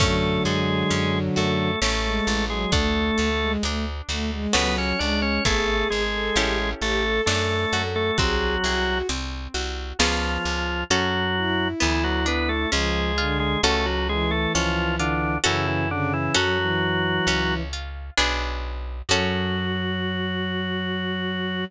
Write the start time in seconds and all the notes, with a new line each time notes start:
0.00 F#2 D3 F#3 A3 C#4 A4, kick, crash
0.45 F#2 G#3 G#4 A4
0.91 F#2 C#4, closed hi-hat
1.36 F#2 A3 F#4 A4
1.82 A1 A3 C#4 A4, snare
2.05 G#3
2.27 A1 A4
2.50 F#3 G#3 G#4
2.72 D2 A3 D4 A4, kick, closed hi-hat
3.18 D2 A4
3.41 G#3
3.63 D2 A3 D4, closed hi-hat
4.09 D2 A3 F#4
4.32 G#3
4.53 C#2 F#3 B3 C#4 F#4 A4 B4, snare
4.78 C#4 C#5
4.99 C#2 G#3 D4 D5
5.22 C#4 C#5
5.45 G#1 A3 B3 E4 G#4 A4, kick, closed hi-hat
5.90 G#1 G#3 G#4
6.14 A4
6.36 A1 C#4 E4 G4 A4, closed hi-hat
6.81 A1 A3 G4 A4
7.04 A4
7.26 F#2 A3 D4 A4, snare
7.73 F#2 F#4 A4
7.96 A3 A4
8.18 C2 F#3 C4 F#4 G#4, kick, closed hi-hat
8.64 C2 F#4 G#4
9.09 C2 C4, closed hi-hat
9.54 C2 F#4
9.99 C#2 F3 B3 C#4 F4 G#4, snare
10.45 C#2
10.90 F#2 F#3 C#4 F#4 A4
11.36 E4
11.80 D2 E3 B3 E4
12.04 F#3 F#4
12.26 B3 D4 B4
12.49 A3 A4
12.72 C#2 F3 G#3 C#4 G#4
13.18 D3 F4
13.40 G#3 G#4
13.63 C#2 A3 C#4 F#4 A4
13.86 F#3 F#4
14.09 E3 G#3 G#4
14.31 A3 A4
14.55 C#2 F3 C#4 F4
14.99 D3 D4 F4
15.44 F#2 C#3 E3 C#4 E4 F#4 A4
15.68 E3 E4
15.91 C#3 D3 D4
16.13 E3 E4
16.34 F#2 F#3 C#4 F#4 A4
16.59 E3
17.27 C#2 C#4
17.73 F4
18.17 B1 B3 D4 G#4
19.09 F#2 F#3 C#4 F#4 A4